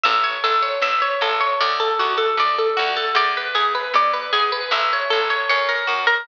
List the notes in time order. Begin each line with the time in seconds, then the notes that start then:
0.03 A1 E5
0.24 C#5
0.44 A1 A4
0.63 C#5
0.81 A1 E5
1.02 C#5
1.21 A1 A4
1.41 C#5
1.61 D2 D5
1.80 A4
1.99 D2 F#4
2.18 A4
2.37 D2 D5
2.58 A4
2.77 D2 F#4
2.96 A4
3.15 E2 D5
3.37 B4
3.55 E2 G#4
3.75 B4
3.94 E2 D5
4.13 B4
4.33 E2 G#4
4.52 B4
4.71 A1 E5
4.93 C#5
5.10 A1 A4
5.30 C#5
5.49 F#2 C#5
5.69 A#4
5.87 F#2 F#4
6.07 A#4